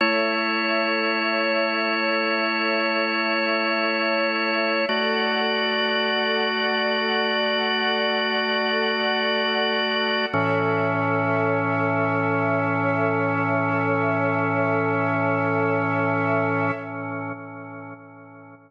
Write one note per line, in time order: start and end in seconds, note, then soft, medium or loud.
0.00 4.85 A3 medium
0.00 4.85 E4 medium
0.00 4.85 A4 medium
0.00 4.85 C#5 medium
0.00 4.85 E5 medium
4.89 10.26 A3 medium
4.89 10.26 F#4 medium
4.89 10.27 A4 medium
4.89 10.26 D5 medium
4.89 10.27 D5 medium
4.89 10.27 F#5 medium
10.33 16.71 A2 loud
10.33 16.71 E3 medium
10.33 16.71 C#4 loud
10.33 16.71 A4 loud
10.33 16.71 C#5 loud
10.33 16.71 E5 loud